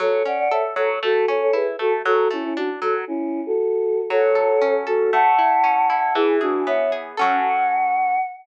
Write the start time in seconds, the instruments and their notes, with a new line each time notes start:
0.00 orchestral harp F#3, choir aahs A4 C#5
0.25 orchestral harp C#4, choir aahs D5 F#5
0.39 choir aahs D5 F#5
0.51 orchestral harp A4, choir aahs C#5 E5
0.76 orchestral harp F#3, choir aahs A4 C#5
1.03 orchestral harp A3, choir aahs F#4 A4
1.28 orchestral harp C#4, choir aahs A4 C#5
1.42 choir aahs A4 C#5
1.53 orchestral harp E4, choir aahs G#4 B4
1.79 orchestral harp A3, choir aahs F#4 A4
2.05 orchestral harp F#3, choir aahs F#4 A4
2.31 orchestral harp A3, choir aahs C#4 E4
2.44 choir aahs C#4 E4
2.57 choir aahs D4 F#4, orchestral harp D4
2.82 orchestral harp F#3, choir aahs F#4 A4
3.07 choir aahs C#4 E4
3.46 choir aahs F#4 A4
4.10 orchestral harp F#3, choir aahs A4 C#5
4.35 orchestral harp A4
4.62 orchestral harp C#4
4.87 choir aahs F#4 A4, orchestral harp A4
5.12 orchestral harp A3, choir aahs F#5 A5
5.39 orchestral harp E4
5.64 orchestral harp C#4
5.90 orchestral harp E4, choir aahs F#5 A5
6.15 orchestral harp E3, choir aahs E4 G#4
6.41 choir aahs D4 F#4, orchestral harp G#4
6.66 orchestral harp B3, choir aahs C#5 E5
6.92 orchestral harp G#4
7.17 orchestral harp F#3 C#4 A4, choir aahs F#5